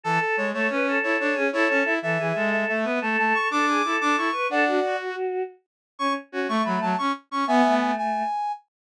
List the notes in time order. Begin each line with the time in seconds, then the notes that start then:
0.04 E3 A4
0.21 A4
0.37 G#3 C#5
0.53 A3 A4 C#5
0.70 C#4 B4
0.87 A4
1.03 E4 C#5
1.20 D4 C#5
1.34 C#4 G#4
1.52 E4 A4 C#5
1.69 C#4 C#5
1.85 E4 E5
2.02 E3 A4 E5
2.18 E3 G#4
2.35 G#3 A4
2.52 E5
2.68 A3 E5
2.85 B3 B4
3.01 A3 A4 A5
3.18 A3 A5
3.34 C#6
3.51 D4 A4 D6
3.68 G#4
3.84 E4 A4
4.01 D4 D6
4.17 E4 C#6
4.32 B4
4.49 D4 A4 D5 F#5
4.67 F#4
4.84 F#4
5.99 C#4 C#6
6.32 C#4 F#4
6.48 A3 C#6
6.65 F#3 B5
6.81 F#3 A5
6.98 C#4 C#6
7.31 C#4 C#6
7.47 B3 E5 G#5
7.64 A3
7.81 G#5
7.98 G#5